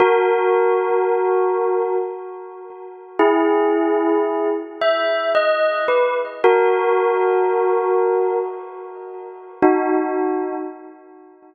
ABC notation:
X:1
M:3/4
L:1/16
Q:1/4=56
K:F#mix
V:1 name="Tubular Bells"
[FA]8 z4 | [EG]6 e2 d2 B z | [FA]8 z4 | [DF]4 z8 |]